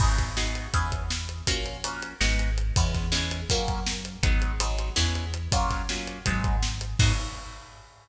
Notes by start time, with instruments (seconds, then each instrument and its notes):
0.00 synth bass 1 G#1, acoustic guitar (steel) B3 D#4 F#4 G#4, kick, crash
0.18 kick, snare, closed hi-hat
0.37 acoustic guitar (steel) B3 D#4 F#4 G#4, snare
0.55 closed hi-hat
0.74 synth bass 1 E2, acoustic guitar (steel) B3 C#4 E4 G#4, kick, closed hi-hat
0.92 kick, closed hi-hat
1.10 snare
1.29 closed hi-hat
1.47 synth bass 1 A#1, acoustic guitar (steel) A#3 C#4 F4 F#4, kick, closed hi-hat
1.66 closed hi-hat
1.84 acoustic guitar (steel) A#3 C#4 F4 F#4, closed hi-hat
2.02 closed hi-hat
2.21 synth bass 1 G#1, acoustic guitar (steel) G#3 B3 D#4 F#4, snare
2.39 closed hi-hat
2.58 closed hi-hat
2.76 synth bass 1 E2, acoustic guitar (steel) G#3 B3 C#4 E4, kick, closed hi-hat
2.94 kick, snare, closed hi-hat
3.12 acoustic guitar (steel) G#3 B3 C#4 E4, snare
3.31 closed hi-hat
3.49 synth bass 1 F#2, acoustic guitar (steel) F#3 A#3 C#4 F4, kick, closed hi-hat
3.68 kick, closed hi-hat
3.87 snare
4.05 closed hi-hat
4.22 synth bass 1 G#1, acoustic guitar (steel) F#3 G#3 B3 D#4, kick, closed hi-hat
4.42 closed hi-hat
4.60 acoustic guitar (steel) F#3 G#3 B3 D#4, closed hi-hat
4.79 closed hi-hat
4.96 synth bass 1 E2, acoustic guitar (steel) G#3 B3 C#4 E4, snare
5.15 closed hi-hat
5.34 closed hi-hat
5.51 synth bass 1 F#2, acoustic guitar (steel) F#3 A#3 C#4 F4, kick, closed hi-hat
5.70 kick, snare, closed hi-hat
5.89 acoustic guitar (steel) F#3 A#3 C#4 F4, snare
6.07 closed hi-hat
6.26 synth bass 1 G#1, acoustic guitar (steel) F#3 G#3 B3 D#4, kick, closed hi-hat
6.44 kick, closed hi-hat
6.63 snare
6.81 closed hi-hat
6.99 synth bass 1 G#2, acoustic guitar (steel) B3 D#4 F#4 G#4, kick, crash